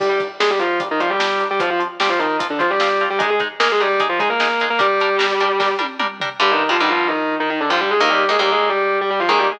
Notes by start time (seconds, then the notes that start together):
0.00 G3 D4 G4 A#4, kick, crash
0.09 G3 G4
0.20 G3 D4 A#4, kick, closed hi-hat
0.40 G3 G#3 D4 G#4 A#4, snare
0.50 G3 G4
0.59 F3 G3 D4 F4 A#4, closed hi-hat
0.80 G3 D4 A#4, kick, closed hi-hat
0.91 D#3 D#4
1.00 F3 G3 D4 F4 A#4, kick, closed hi-hat
1.09 G3 G4
1.19 G3 D4 A#4, snare
1.40 G3 D4 A#4, closed hi-hat
1.51 G3 G4
1.60 F3 C4 F4, kick, closed hi-hat
1.70 F3 F4
1.80 F3 C4 F4, closed hi-hat
2.00 F3 G3 C4 F4 G4, snare
2.09 F3 F4
2.19 D#3 F3 C4 D#4 F4, closed hi-hat
2.39 F3 C4 F4, kick, closed hi-hat
2.50 D3 D4
2.59 F3 C4 F4, kick, closed hi-hat
2.70 G3 G4
2.80 F3 C4 F4, snare
3.00 F3 C4 F4, closed hi-hat
3.10 G3 G4
3.19 G#3 D#4 G#4, kick, closed hi-hat
3.30 G#3 G#4
3.40 G#3 D#4 G#4, kick, closed hi-hat
3.60 G#3 A#3 D#4 G#4 A#4, snare
3.72 G#3 G#4
3.80 G3 G#3 D#4 G4 G#4, closed hi-hat
4.00 G#3 D#4 G#4, kick, closed hi-hat
4.09 F3 F4
4.19 G#3 D#4 G#4, kick, closed hi-hat
4.29 A#3 A#4
4.40 G#3 D#4 G#4, snare
4.60 G#3 D#4 G#4, closed hi-hat
4.70 A#3 A#4
4.79 G3 D4 G4 A#4, kick, closed hi-hat
5.00 G3 D4 A#4, closed hi-hat
5.19 G3 D4 A#4, snare
5.40 G3 D4 A#4, closed hi-hat
5.60 G3 D4 A#4, kick, snare
5.79 G3 D4 A#4, high tom
6.00 G3 D4 A#4, mid tom
6.20 G3 D4 A#4, floor tom
6.40 G2 D3 G3 G4
6.51 D#3 D#4
6.69 G2 D3 F3 G3 F4
6.80 G2 D3 D#3 G3 D#4
6.89 F3 F4
7.08 D#3 D#4
7.40 D#3 D#4
7.50 D#3 D#4
7.61 D3 D4
7.70 G2 D3 F3 G3 F4
7.80 G3 G4
7.91 G#3 G#4
8.00 D#2 D#3 A#3 A#4
8.10 G3 G4
8.29 D#2 D#3 G#3 A#3 G#4
8.39 D#2 D#3 G3 A#3 G4
8.52 G#3 G#4
8.70 G3 G4
9.01 G3 G4
9.10 G3 G4
9.20 F3 F4
9.29 D#2 D#3 G#3 A#3 G#4
9.39 G3 G4
9.52 G#3 G#4